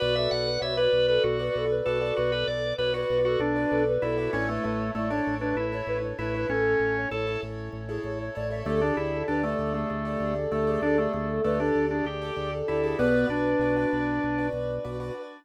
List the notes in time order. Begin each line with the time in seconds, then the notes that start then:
0.00 B1 F#4 B4 D5
0.15 A4 E5
0.31 B1 A4 F#5
0.45 B4
0.61 B1 F#4 B4 C#5 D5 E5
0.76 F#4 B4 D5
0.93 B1
1.08 A4 B4
1.24 B1 F#4
1.39 F#4 B4 D5
1.55 B1 A4
1.70 B4
1.84 B1 F#4 A4 B4 D5
2.00 F#4 A4 B4 D5
2.16 B1 F#4 B4
2.32 A4 B4
2.47 B1 A4 D5
2.64 B4
2.78 B1 F#4 B4 C#5 D5
2.94 F#4 B4 D5
3.10 B1
3.25 F#4 A4
3.39 B1 D4
3.56 F#4 B4 D5
3.69 B1 A4
3.88 B4
4.02 B1 E4 F#4 A4 B4 D5
4.18 F#4 A4 B4 D5
4.33 A1 C#4 E4 A4 C#5
4.48 A3 B4
4.64 A1 A3 B4
4.80 C#5
4.95 A1 A3 E4 A4 C#5 D5
5.10 D4 E4 A4 C#5
5.27 A1
5.39 D4 B4
5.56 A1 E4
5.72 E4 A4 C#5
5.87 A1 B4
6.03 C#5
6.19 A1 E4 A4 B4 C#5
6.34 E4 A4 B4 C#5
6.49 A1 C#4 A4
6.65 A4
6.79 A1 A4
6.97 C#5
7.11 A1 E4 A4 C#5
7.27 E4 A4 C#5
7.43 A1
7.72 A1 C#5
7.88 E4 G#4 A4 C#5
8.03 A1 C#5
8.21 C#5
8.35 A1 E4 A4 C#5 D5
8.51 E4 A4 C#5 E5
8.65 D2 A3 G4 A4 D5
8.80 D4 G#4
8.97 D2 E4 G#4
9.13 A4
9.28 D2 D4 G4 A4 B4 D5
9.43 A3 G4 A4 D5
9.59 D2
9.73 A3 G#4
9.90 D2 A3
10.04 G4 A4 D5
10.20 D2 G#4
10.36 A4
10.51 D2 A3 G4 A4 D5
10.67 G4 G#4 A4 D5
10.81 D2 D4 A4
10.97 A3 G#4
11.13 D2 A3 G#4
11.29 A4
11.44 D2 A3 G4 A4 B4 D5
11.59 D4 G4 A4 D5
11.75 D2
11.91 D4 G#4
12.05 D2 G4
12.22 G4 A4 D5
12.36 D2 G#4
12.51 A4
12.68 D2 E4 G4 A4 D5
12.84 G4 G#4 A4 D5
12.97 B1 B3 F#4 B4 D5
13.29 B1 D4
13.59 B1 F#4 B4 D5
13.76 F#4 B4 D5
13.93 B1
14.23 B1
14.38 F#4 B4 D5
14.53 B1
14.85 B1 F#4 B4 D5
15.00 F#4 B4 D5